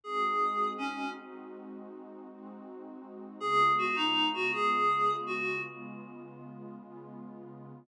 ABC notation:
X:1
M:12/8
L:1/8
Q:3/8=107
K:Ab
V:1 name="Clarinet"
A4 D2 | z12 | A2 _G E2 G A4 G2 | z12 |]
V:2 name="Pad 2 (warm)"
[A,CE_G]6 | [A,CE_G]6 [A,CEG]6 | [D,A,_CF]6 [D,A,CF]6 | [D,A,_CF]6 [D,A,CF]6 |]